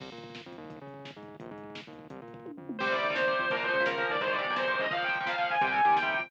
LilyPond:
<<
  \new Staff \with { instrumentName = "Distortion Guitar" } { \time 6/8 \key c \minor \tempo 4. = 171 r2. | r2. | r2. | r2. |
c''8 d''4 c''4 c''8 | bes'8 c''4 bes'4 d''8 | c''8 d''4 c''4 ees''8 | f''8 g''4 f''4 aes''8 |
g''8 aes''4 g''4 g''8 | }
  \new Staff \with { instrumentName = "Overdriven Guitar" } { \clef bass \time 6/8 \key c \minor r2. | r2. | r2. | r2. |
<c g>16 <c g>8 <c g>8 <c g>16 <c g>8 <c g>4 | <bes, f>16 <bes, f>8 <bes, f>8 <bes, f>16 <bes, f>8 <bes, f>4 | <aes, c ees>16 <aes, c ees>8 <aes, c ees>8 <aes, c ees>16 <aes, c ees>8 <aes, c ees>4 | <bes, f>16 <bes, f>8 <bes, f>8 <bes, f>16 <bes, f>8 <bes, f>4 |
<c g>16 <c g>8. <c g>8. <c g>4~ <c g>16 | }
  \new Staff \with { instrumentName = "Synth Bass 1" } { \clef bass \time 6/8 \key c \minor c,8 bes,4. f,8 ees,8~ | ees,8 des4. aes,4 | bes,,8 aes,4. ees,4 | c,8 bes,4. f,4 |
c,4 ees,4. f,8 | bes,,4 des,4. ees,8 | aes,,4 b,,4. des,8 | r2. |
c,4 ees,4. f,8 | }
  \new DrumStaff \with { instrumentName = "Drums" } \drummode { \time 6/8 <cymc bd>16 bd16 bd16 <hh bd>16 bd16 bd16 <bd sn>16 bd16 bd16 <hh bd>16 bd16 bd16 | <hh bd>16 bd16 bd16 <hh bd>16 bd16 bd16 <bd sn>16 bd16 bd16 <hh bd>16 bd16 bd16 | <hh bd>16 bd16 bd16 <hh bd>16 bd16 bd16 <bd sn>16 bd16 bd16 <hh bd>16 bd16 bd16 | <hh bd>16 bd16 bd16 <hh bd>16 bd16 bd16 <bd tommh>8 tomfh8 toml8 |
<cymc bd>16 <hh bd>16 <hh bd>16 <hh bd>16 <hh bd>16 <hh bd>16 <bd sn>16 <hh bd>16 <hh bd>16 <hh bd>16 <hh bd>16 <hh bd>16 | <hh bd>16 <hh bd>16 <hh bd>16 <hh bd>16 <hh bd>16 <hh bd>16 <bd sn>16 <hh bd>16 <hh bd>16 <hh bd>16 <hh bd>16 <hh bd>16 | <hh bd>16 <hh bd>16 <hh bd>16 <hh bd>16 <hh bd>16 <hh bd>16 <bd sn>16 <hh bd>16 <hh bd>16 <hh bd>16 <hh bd>16 <hh bd>16 | <hh bd>16 <hh bd>16 <hh bd>16 <hh bd>16 <hh bd>16 <hh bd>16 <bd sn>16 <hh bd>16 <hh bd>16 <hh bd>16 <hh bd>16 <hh bd>16 |
<hh bd>16 <hh bd>16 <hh bd>16 <hh bd>16 <hh bd>16 <hh bd>16 <bd sn>16 <hh bd>16 <hh bd>16 <hh bd>16 <hh bd>16 <hh bd>16 | }
>>